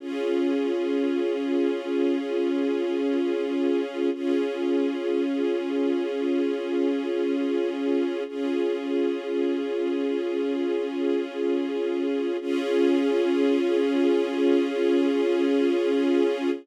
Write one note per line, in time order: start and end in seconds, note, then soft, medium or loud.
0.00 4.10 C#4 medium
0.00 4.10 F4 medium
0.00 4.10 G#4 medium
4.14 8.23 C#4 medium
4.14 8.23 F4 medium
4.14 8.23 G#4 medium
8.28 12.37 C#4 medium
8.28 12.37 F4 medium
8.28 12.37 G#4 medium
12.41 16.50 C#4 loud
12.41 16.50 F4 loud
12.41 16.50 G#4 loud